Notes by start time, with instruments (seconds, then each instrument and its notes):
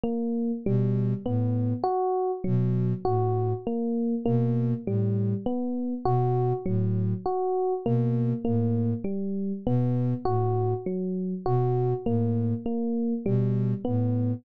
0.04 electric piano 1 A#3
0.66 ocarina B2, electric piano 1 G3
1.26 ocarina A2, electric piano 1 B3
1.83 electric piano 1 F#4
2.44 ocarina B2, electric piano 1 F#3
3.05 ocarina A2, electric piano 1 F#4
3.67 electric piano 1 A#3
4.25 ocarina B2, electric piano 1 A#3
4.86 ocarina A2, electric piano 1 G3
5.46 electric piano 1 B3
6.05 ocarina B2, electric piano 1 F#4
6.66 ocarina A2, electric piano 1 F#3
7.25 electric piano 1 F#4
7.85 ocarina B2, electric piano 1 A#3
8.45 ocarina A2, electric piano 1 A#3
9.04 electric piano 1 G3
9.66 ocarina B2, electric piano 1 B3
10.25 ocarina A2, electric piano 1 F#4
10.86 electric piano 1 F#3
11.46 ocarina B2, electric piano 1 F#4
12.06 ocarina A2, electric piano 1 A#3
12.66 electric piano 1 A#3
13.26 ocarina B2, electric piano 1 G3
13.85 ocarina A2, electric piano 1 B3